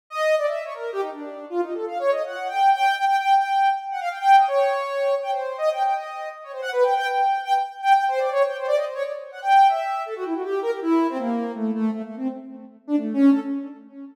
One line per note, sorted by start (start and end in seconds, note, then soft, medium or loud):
0.10 0.35 D#5 loud
0.38 0.46 D5 medium
0.47 0.63 E5 medium
0.65 0.73 C#5 medium
0.74 0.91 A#4 medium
0.93 1.01 G4 loud
1.02 1.10 D#4 medium
1.12 1.45 D4 soft
1.50 1.61 F4 medium
1.62 1.73 D#4 medium
1.74 1.85 A4 medium
1.87 1.98 F5 medium
1.99 2.10 C#5 loud
2.11 2.23 D#5 medium
2.25 2.48 F#5 medium
2.48 2.70 G5 medium
2.73 2.95 G5 loud
2.97 3.05 G5 loud
3.08 3.16 G5 loud
3.18 3.34 G5 medium
3.36 3.69 G5 medium
3.91 4.00 F#5 medium
4.01 4.09 F5 loud
4.10 4.19 G5 medium
4.19 4.36 G5 loud
4.37 4.46 D#5 medium
4.48 5.15 C#5 medium
5.22 5.31 G5 medium
5.31 5.57 C5 medium
5.58 5.69 D#5 loud
5.72 5.83 G5 medium
5.83 5.94 G5 medium
5.95 6.29 D#5 medium
6.43 6.52 C#5 medium
6.52 6.61 C5 medium
6.62 6.70 F#5 loud
6.72 6.84 B4 loud
6.83 6.94 G5 medium
6.96 7.07 G5 loud
7.07 7.41 G5 medium
7.45 7.53 G5 loud
7.82 7.93 G5 loud
7.93 8.05 G5 medium
8.08 8.19 C5 loud
8.19 8.30 D5 medium
8.31 8.43 C#5 loud
8.45 8.57 G5 medium
8.58 8.66 C5 medium
8.67 8.76 D5 loud
8.76 8.85 D#5 medium
8.85 8.94 C5 medium
8.94 9.03 C#5 loud
9.04 9.12 D5 soft
9.32 9.40 F#5 medium
9.42 9.67 G5 medium
9.69 10.02 E5 medium
10.06 10.14 A4 medium
10.16 10.24 F#4 medium
10.25 10.34 E4 medium
10.34 10.43 F#4 medium
10.43 10.60 G4 medium
10.62 10.71 A#4 loud
10.71 10.80 G4 medium
10.82 11.07 E4 loud
11.09 11.18 C4 loud
11.18 11.52 A#3 medium
11.55 11.71 A3 medium
11.74 11.90 A3 medium
11.91 12.02 A3 medium
12.04 12.15 A3 medium
12.16 12.28 C4 medium
12.87 12.96 D4 loud
12.96 13.13 A3 medium
13.13 13.30 C#4 loud
13.31 13.40 A4 medium